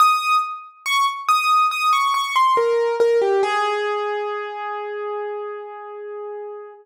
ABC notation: X:1
M:4/4
L:1/16
Q:1/4=70
K:Ab
V:1 name="Acoustic Grand Piano"
e'2 z2 d' z e'2 e' d' d' c' B2 B G | A16 |]